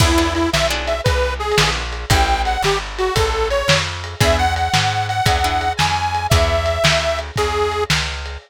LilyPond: <<
  \new Staff \with { instrumentName = "Harmonica" } { \time 12/8 \key e \major \tempo 4. = 114 e'4 e'8 e''8 r8 e''8 b'4 gis'4 r4 | g''4 fis''8 g'8 r8 fis'8 a'4 cis''4 r4 | e''8 fis''8 fis''4. fis''2 gis''4. | e''2. gis'4. r4. | }
  \new Staff \with { instrumentName = "Acoustic Guitar (steel)" } { \time 12/8 \key e \major <b d' e' gis'>8 <b d' e' gis'>4. <b d' e' gis'>2~ <b d' e' gis'>8 <b d' e' gis'>4. | <cis' e' g' a'>1. | <b d' e' gis'>2. <b d' e' gis'>8 <b d' e' gis'>2~ <b d' e' gis'>8 | <b d' e' gis'>1. | }
  \new Staff \with { instrumentName = "Electric Bass (finger)" } { \clef bass \time 12/8 \key e \major e,4. b,,4. c,4. ais,,4. | a,,4. g,,4. a,,4. f,4. | e,4. gis,4. e,4. f,4. | e,4. d,4. e,4. cis,4. | }
  \new DrumStaff \with { instrumentName = "Drums" } \drummode { \time 12/8 <cymc bd>4 cymr8 sn4 cymr8 \tuplet 3/2 { <bd cymr>16 r16 r16 r16 r16 r16 r16 r16 cymr16 } sn4 cymr8 | <bd cymr>4 cymr8 sn4 cymr8 <bd cymr>4 cymr8 sn4 cymr8 | <bd cymr>4 cymr8 sn4 cymr8 <bd cymr>4 cymr8 sn4 cymr8 | <bd cymr>4 cymr8 sn4 cymr8 <bd cymr>4 cymr8 sn4 cymr8 | }
>>